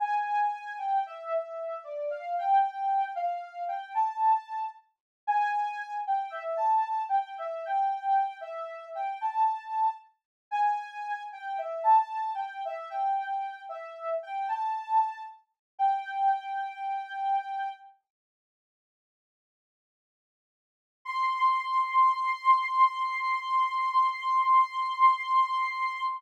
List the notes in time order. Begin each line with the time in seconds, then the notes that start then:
0.00 G#5
0.78 G5
1.06 E5
1.32 E5
1.84 D5
2.10 F5
2.38 G5
3.15 F5
3.68 G5
3.95 A5
5.27 G#5
6.07 G5
6.30 E5
6.57 A5
7.09 G5
7.38 E5
7.65 G5
8.41 E5
8.95 G5
9.21 A5
10.51 G#5
11.32 G5
11.58 E5
11.84 A5
12.35 G5
12.65 E5
12.90 G5
13.69 E5
14.23 G5
14.48 A5
15.79 G5
21.05 C6